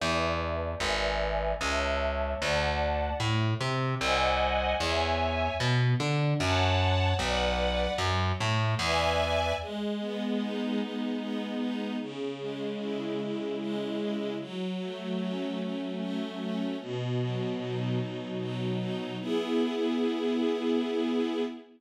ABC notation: X:1
M:3/4
L:1/8
Q:1/4=75
K:A
V:1 name="String Ensemble 1"
[Bdea]2 [Bdeg]2 [cea]2 | [dfa]2 A, =C [^B^dfg]2 | [ceg]2 B, D [cfa]2 | [Bdf]2 F, A, [Bdeg]2 |
[K:E] G, B, D G, B, D | C, G, E C, G, E | F, A, C F, A, C | B,, F, D B,, F, D |
[B,EG]6 |]
V:2 name="Electric Bass (finger)" clef=bass
E,,2 G,,,2 C,,2 | D,,2 A,, =C, ^B,,,2 | E,,2 B,, D, F,,2 | B,,,2 F,, A,, E,,2 |
[K:E] z6 | z6 | z6 | z6 |
z6 |]